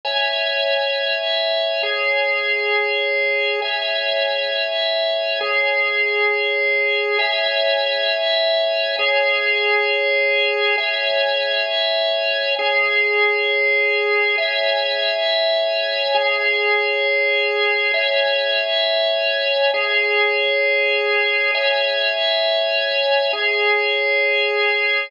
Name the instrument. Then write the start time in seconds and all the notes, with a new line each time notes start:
drawbar organ
0.05 C#5 E5 G#5
1.83 G#4 C#5 G#5
3.62 C#5 E5 G#5
5.41 G#4 C#5 G#5
7.19 C#5 E5 G#5
8.99 G#4 C#5 G#5
10.78 C#5 E5 G#5
12.59 G#4 C#5 G#5
14.38 C#5 E5 G#5
16.15 G#4 C#5 G#5
17.94 C#5 E5 G#5
19.74 G#4 C#5 G#5
21.54 C#5 E5 G#5
23.33 G#4 C#5 G#5